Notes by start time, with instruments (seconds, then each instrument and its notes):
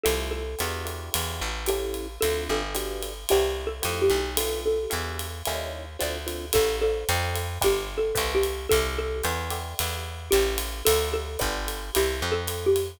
0.03 electric bass (finger) C2, acoustic guitar (steel) A3 E4 F4 G4, xylophone A4, ride
0.31 xylophone A4
0.59 electric bass (finger) E2, acoustic guitar (steel) D4 E4 F#4 G4, hi-hat pedal, ride
0.85 acoustic guitar (steel) D4 E4 F#4 G4, ride
1.14 electric bass (finger) E2, ride
1.41 electric bass (finger) A1
1.66 acoustic guitar (steel) C#4 E4 G4 A4, xylophone G4, hi-hat pedal, ride
1.94 ride
2.21 electric bass (finger) D2, acoustic guitar (steel) C4 D4 F4 A4, xylophone A4, ride
2.49 electric bass (finger) G1, xylophone A4
2.75 acoustic guitar (steel) B3 D4 F#4 G4, hi-hat pedal, ride
3.03 ride
3.29 electric bass (finger) C2, acoustic guitar (steel) B3 C4 D4 E4, xylophone G4, ride
3.67 xylophone A4
3.82 electric bass (finger) F2, acoustic guitar (steel) A3 E4 F4 G4, hi-hat pedal, ride
4.02 xylophone G4
4.10 electric bass (finger) B1, ride
4.37 acoustic guitar (steel) A3 B3 D4 F4, xylophone A4, ride
4.66 xylophone A4
4.90 electric bass (finger) E2, acoustic guitar (steel) G3 D4 E4 F#4, hi-hat pedal, ride
5.19 ride
5.45 electric bass (finger) D#2, acoustic guitar (steel) G3 C#4 D#4 E4, ride
5.99 electric bass (finger) D2, acoustic guitar (steel) A3 C4 D4 F4, xylophone D5, hi-hat pedal, ride
6.26 acoustic guitar (steel) A3 C4 D4 F4, ride
6.53 electric bass (finger) A1, acoustic guitar (steel) G4 A4 C#5 E5, xylophone A4, kick, ride
6.81 xylophone A4, acoustic guitar (steel) A4 C5 D5 F5
7.09 electric bass (finger) F2, hi-hat pedal, ride
7.36 ride
7.61 electric bass (finger) G1, acoustic guitar (steel) G4 B4 D5 F#5, xylophone G4, kick, ride
7.98 xylophone A4
8.15 electric bass (finger) C2, acoustic guitar (steel) B4 C5 D5 E5, kick, hi-hat pedal, ride
8.35 xylophone G4
8.43 ride
8.69 electric bass (finger) C2, xylophone A4, acoustic guitar (steel) A4 E5 F5 G5, kick, ride
8.98 xylophone A4
9.23 electric bass (finger) E2, acoustic guitar (steel) D5 E5 F#5 G5, hi-hat pedal, ride
9.50 acoustic guitar (steel) D5 E5 F#5 G5, ride
9.79 electric bass (finger) E2, ride
10.31 electric bass (finger) A1, xylophone G4, acoustic guitar (steel) C#5 E5 G5 A5, hi-hat pedal, ride
10.58 ride
10.85 electric bass (finger) D2, xylophone A4, acoustic guitar (steel) C5 D5 F5 A5, ride
11.14 xylophone A4
11.39 electric bass (finger) G1, acoustic guitar (steel) B4 D5 F#5 G5, kick, hi-hat pedal, ride
11.68 ride
11.95 electric bass (finger) C2, xylophone G4, acoustic guitar (steel) B4 C5 D5 E5, ride
12.22 electric bass (finger) F2, acoustic guitar (steel) A4 E5 F5 G5
12.32 xylophone A4
12.47 hi-hat pedal, ride
12.66 xylophone G4
12.76 ride